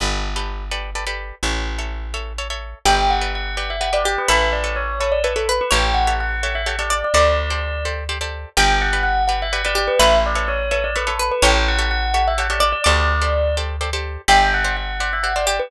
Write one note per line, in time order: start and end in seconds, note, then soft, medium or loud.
0.00 1.32 G1 medium
0.00 0.29 G4 medium
0.00 0.29 A4 medium
0.00 0.29 B4 medium
0.00 0.29 D5 medium
0.36 0.65 G4 medium
0.36 0.65 A4 medium
0.36 0.65 B4 medium
0.36 0.65 D5 medium
0.71 0.90 G4 medium
0.71 0.90 A4 medium
0.71 0.90 B4 medium
0.71 0.90 D5 medium
0.95 1.05 G4 medium
0.95 1.05 A4 medium
0.95 1.05 B4 medium
0.95 1.05 D5 medium
1.07 1.35 G4 medium
1.07 1.35 A4 medium
1.07 1.35 B4 medium
1.07 1.35 D5 medium
1.43 2.74 A1 medium
1.43 1.72 A4 medium
1.43 1.72 C#5 medium
1.43 1.72 E5 medium
1.79 2.07 A4 medium
1.79 2.07 C#5 medium
1.79 2.07 E5 medium
2.14 2.33 A4 medium
2.14 2.33 C#5 medium
2.14 2.33 E5 medium
2.38 2.48 A4 medium
2.38 2.48 C#5 medium
2.38 2.48 E5 soft
2.50 2.79 A4 medium
2.50 2.79 C#5 medium
2.50 2.79 E5 medium
2.85 4.17 G1 medium
2.85 3.86 G4 loud
2.85 3.14 G4 medium
2.85 3.14 B4 medium
2.85 3.14 D5 medium
2.85 3.09 G5 medium
3.10 3.30 F#5 medium
3.21 3.50 G4 medium
3.21 3.50 B4 medium
3.21 3.50 D5 medium
3.35 3.55 F#5 medium
3.57 3.76 G4 medium
3.57 3.76 B4 medium
3.57 3.76 D5 medium
3.57 3.68 F#5 medium
3.70 3.81 E5 medium
3.80 3.90 G4 medium
3.80 3.90 B4 medium
3.80 3.90 D5 medium
3.80 3.92 F#5 medium
3.93 4.21 G4 medium
3.93 4.21 B4 medium
3.93 4.21 D5 medium
3.93 4.04 D5 medium
4.05 4.28 G4 medium
4.05 4.16 D5 medium
4.18 4.29 B4 medium
4.28 5.61 A1 medium
4.28 4.57 A4 medium
4.28 5.44 B4 loud
4.28 4.57 B4 medium
4.28 4.57 C#5 medium
4.28 4.57 E5 medium
4.28 4.48 E5 medium
4.52 4.75 D5 medium
4.64 4.92 A4 medium
4.64 4.92 B4 medium
4.64 4.92 C#5 medium
4.64 4.92 E5 medium
4.76 4.98 C#5 medium
5.00 5.20 A4 medium
5.00 5.20 B4 medium
5.00 5.11 C#5 medium
5.00 5.20 C#5 medium
5.00 5.20 E5 medium
5.12 5.23 D5 medium
5.24 5.33 A4 medium
5.24 5.33 B4 medium
5.24 5.35 B4 medium
5.24 5.33 C#5 medium
5.24 5.33 E5 medium
5.36 5.47 A4 medium
5.36 5.64 A4 medium
5.36 5.64 B4 medium
5.36 5.64 C#5 medium
5.36 5.64 E5 medium
5.49 5.71 B4 medium
5.61 5.72 B4 medium
5.71 7.03 A1 medium
5.71 6.00 G4 medium
5.71 6.00 A4 medium
5.71 6.79 C#5 loud
5.71 6.00 C#5 medium
5.71 6.00 E5 medium
5.71 5.94 G5 medium
5.94 6.13 F#5 medium
6.07 6.36 G4 medium
6.07 6.36 A4 medium
6.07 6.36 C#5 medium
6.07 6.36 E5 medium
6.20 6.43 F#5 medium
6.43 6.62 G4 medium
6.43 6.62 A4 medium
6.43 6.62 C#5 medium
6.43 6.62 E5 medium
6.43 6.54 F#5 medium
6.55 6.66 E5 medium
6.66 6.76 G4 medium
6.66 6.76 A4 medium
6.66 6.76 C#5 medium
6.66 6.76 E5 medium
6.66 6.78 F#5 medium
6.78 7.07 G4 medium
6.78 7.07 A4 medium
6.78 7.07 C#5 medium
6.78 6.90 D5 medium
6.78 7.07 E5 medium
6.90 7.12 D5 loud
6.90 7.02 D5 medium
7.04 7.14 D5 medium
7.14 8.45 D2 medium
7.14 7.43 G4 medium
7.14 7.43 A4 medium
7.14 7.43 C5 medium
7.14 7.43 D5 medium
7.14 7.83 D5 medium
7.14 7.75 D5 loud
7.50 7.79 G4 medium
7.50 7.79 A4 medium
7.50 7.79 C5 medium
7.50 7.79 D5 medium
7.85 8.04 G4 medium
7.85 8.04 A4 medium
7.85 8.04 C5 medium
7.85 8.04 D5 medium
8.09 8.18 G4 medium
8.09 8.18 A4 medium
8.09 8.18 C5 medium
8.09 8.18 D5 medium
8.21 8.49 G4 medium
8.21 8.49 A4 medium
8.21 8.49 C5 medium
8.21 8.49 D5 medium
8.57 9.89 G1 loud
8.57 8.85 G4 medium
8.57 9.57 G4 loud
8.57 8.85 B4 medium
8.57 8.85 D5 medium
8.57 8.82 G5 medium
8.81 9.01 F#5 medium
8.93 9.22 G4 medium
8.93 9.22 B4 medium
8.93 9.22 D5 medium
9.03 9.23 F#5 medium
9.27 9.48 G4 medium
9.27 9.48 B4 medium
9.27 9.48 D5 medium
9.27 9.38 F#5 medium
9.42 9.53 E5 medium
9.52 9.62 G4 medium
9.52 9.62 B4 medium
9.52 9.62 D5 medium
9.52 9.63 F#5 medium
9.65 9.93 G4 medium
9.65 9.93 B4 medium
9.65 9.93 D5 medium
9.65 9.77 D5 medium
9.75 9.98 G4 loud
9.75 9.89 D5 medium
9.87 9.98 B4 medium
9.99 11.31 A1 medium
9.99 10.29 A4 medium
9.99 11.15 B4 loud
9.99 10.29 B4 medium
9.99 10.29 C#5 medium
9.99 10.18 E5 loud
9.99 10.29 E5 medium
10.26 10.49 D5 medium
10.35 10.64 A4 medium
10.35 10.64 B4 medium
10.35 10.64 C#5 medium
10.35 10.64 E5 medium
10.48 10.70 C#5 medium
10.71 10.90 A4 medium
10.71 10.90 B4 medium
10.71 10.90 C#5 medium
10.71 10.83 C#5 medium
10.71 10.90 E5 medium
10.84 10.95 D5 medium
10.96 11.05 A4 medium
10.96 11.05 B4 medium
10.96 11.08 B4 medium
10.96 11.05 C#5 medium
10.96 11.05 E5 medium
11.07 11.35 A4 medium
11.07 11.19 A4 medium
11.07 11.35 B4 medium
11.07 11.35 C#5 medium
11.07 11.35 E5 medium
11.19 11.42 B4 loud
11.31 11.43 B4 medium
11.42 12.74 A1 loud
11.42 11.72 G4 medium
11.42 11.72 A4 medium
11.42 12.51 C#5 loud
11.42 11.72 C#5 medium
11.42 11.72 E5 medium
11.42 11.65 G5 medium
11.68 11.87 F#5 medium
11.79 12.07 G4 medium
11.79 12.07 A4 medium
11.79 12.07 C#5 medium
11.79 12.07 E5 medium
11.90 12.13 F#5 medium
12.13 12.33 G4 medium
12.13 12.33 A4 medium
12.13 12.33 C#5 medium
12.13 12.33 E5 medium
12.13 12.25 F#5 medium
12.27 12.38 E5 medium
12.38 12.48 G4 medium
12.38 12.48 A4 medium
12.38 12.48 C#5 medium
12.38 12.48 E5 medium
12.38 12.50 F#5 medium
12.50 12.78 G4 medium
12.50 12.78 A4 medium
12.50 12.78 C#5 medium
12.50 12.61 D5 medium
12.50 12.78 E5 medium
12.60 12.82 D5 loud
12.60 12.71 D5 medium
12.72 12.83 D5 medium
12.84 14.17 D2 medium
12.84 13.14 G4 medium
12.84 13.14 A4 medium
12.84 13.14 C5 medium
12.84 13.45 D5 loud
12.84 13.14 D5 medium
12.84 13.55 D5 medium
13.22 13.50 G4 medium
13.22 13.50 A4 medium
13.22 13.50 C5 medium
13.22 13.50 D5 medium
13.57 13.76 G4 medium
13.57 13.76 A4 medium
13.57 13.76 C5 medium
13.57 13.76 D5 medium
13.81 13.90 G4 medium
13.81 13.90 A4 medium
13.81 13.90 C5 medium
13.81 13.90 D5 medium
13.93 14.22 G4 medium
13.93 14.22 A4 medium
13.93 14.22 C5 medium
13.93 14.22 D5 medium
14.28 15.60 G1 medium
14.28 15.38 G4 loud
14.28 14.57 G4 medium
14.28 14.57 C5 medium
14.28 14.57 D5 medium
14.28 14.52 G5 medium
14.54 14.76 F#5 medium
14.64 14.93 G4 medium
14.64 14.93 C5 medium
14.64 14.93 D5 medium
14.76 14.97 F#5 medium
15.00 15.19 G4 medium
15.00 15.19 C5 medium
15.00 15.19 D5 medium
15.00 15.11 F#5 medium
15.12 15.24 E5 medium
15.23 15.33 G4 medium
15.23 15.33 C5 medium
15.23 15.33 D5 medium
15.23 15.34 F#5 medium
15.36 15.64 G4 medium
15.36 15.64 C5 medium
15.36 15.45 D5 medium
15.36 15.64 D5 medium
15.46 15.70 G4 loud
15.46 15.57 D5 medium
15.59 15.70 B4 medium